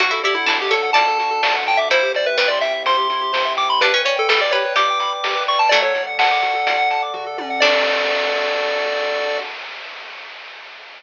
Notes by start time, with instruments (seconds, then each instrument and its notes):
0.00 synth bass 1 D2, pad 2 (warm) D4 F#4 A4, lead 1 (square) F#4, harpsichord F#4, kick, closed hi-hat
0.11 harpsichord E4, lead 1 (square) A4
0.23 synth bass 1 D2, harpsichord E4, lead 1 (square) G4 D5, closed hi-hat
0.35 lead 1 (square) E4 F#5
0.46 synth bass 1 D2, harpsichord D4, lead 1 (square) E4 A5, snare
0.60 lead 1 (square) G4 D6
0.71 synth bass 1 D2, lead 1 (square) A4 A5, harpsichord C#5, kick, closed hi-hat
0.83 lead 1 (square) F#5
0.93 synth bass 1 D2, harpsichord D5, lead 1 (square) D5 A5, kick, closed hi-hat
1.07 lead 1 (square) A4
1.18 synth bass 1 D2, lead 1 (square) F#4, closed hi-hat
1.31 lead 1 (square) A4
1.43 synth bass 1 D2, lead 1 (square) D5, snare
1.55 lead 1 (square) F#5
1.66 synth bass 1 D2, lead 1 (square) G5 A5, kick, closed hi-hat
1.77 lead 1 (square) E5 D6
1.90 synth bass 1 C2, pad 2 (warm) C4 E4 G4, lead 1 (square) E4 C5, harpsichord E4, kick, closed hi-hat
2.02 lead 1 (square) G4
2.14 synth bass 1 C2, lead 1 (square) C5 D5, closed hi-hat
2.26 lead 1 (square) B4 E5
2.37 synth bass 1 C2, harpsichord G3, lead 1 (square) B4 G5, snare
2.48 lead 1 (square) D5 C6
2.61 synth bass 1 C2, lead 1 (square) E5 G5, kick, closed hi-hat
2.74 lead 1 (square) E5
2.85 synth bass 1 C2, lead 1 (square) C5 C6, kick, closed hi-hat
2.97 lead 1 (square) G4
3.10 synth bass 1 C2, lead 1 (square) E4, closed hi-hat
3.21 lead 1 (square) G4
3.33 synth bass 1 C2, lead 1 (square) C5, snare
3.45 lead 1 (square) E5
3.57 synth bass 1 C2, lead 1 (square) G5 D6, closed hi-hat
3.69 lead 1 (square) B5 C6
3.80 synth bass 1 G1, harpsichord D4, lead 1 (square) G4 B4, pad 2 (warm) B4 D5 G5, kick, closed hi-hat
3.93 harpsichord C#4, lead 1 (square) B4
4.05 synth bass 1 G1, harpsichord C#4, lead 1 (square) C#5 D5, closed hi-hat
4.16 lead 1 (square) A4 G5
4.28 synth bass 1 G1, harpsichord G3, lead 1 (square) A4 B5, snare
4.41 lead 1 (square) D5 D6
4.51 synth bass 1 G1, lead 1 (square) G4 C#5, harpsichord B4, closed hi-hat
4.65 lead 1 (square) B4
4.75 synth bass 1 G1, harpsichord G4, lead 1 (square) D5 D6, kick, closed hi-hat
4.88 lead 1 (square) G5
5.00 synth bass 1 G1, lead 1 (square) B5, closed hi-hat
5.12 lead 1 (square) D6
5.22 synth bass 1 G1, lead 1 (square) G4, snare
5.35 lead 1 (square) B4
5.47 synth bass 1 G1, lead 1 (square) D5 C#6, open hi-hat
5.59 lead 1 (square) G5 A5
5.69 synth bass 1 D2, harpsichord F#3 A3, lead 1 (square) F#4 D5, pad 2 (warm) A4 D5 F#5, kick, closed hi-hat
5.82 lead 1 (square) A4 C#5
5.95 synth bass 1 D2, lead 1 (square) D5, kick, closed hi-hat
6.07 lead 1 (square) F#5
6.18 synth bass 1 D2, lead 1 (square) F#5 A5, snare
6.31 lead 1 (square) D6
6.42 synth bass 1 D2, lead 1 (square) F#4, kick, closed hi-hat
6.55 lead 1 (square) A4
6.67 synth bass 1 D2, lead 1 (square) D5, kick, closed hi-hat
6.78 lead 1 (square) F#5
6.90 synth bass 1 D2, lead 1 (square) A5, closed hi-hat
7.02 lead 1 (square) D6
7.14 synth bass 1 D2, lead 1 (square) F#4, kick, floor tom
7.26 lead 1 (square) A4
7.38 synth bass 1 D2, lead 1 (square) D5, high tom
7.50 lead 1 (square) F#5
7.60 synth bass 1 D2, harpsichord D4, pad 2 (warm) D4 F#4 A4, lead 1 (square) F#4 A4 D5, kick, crash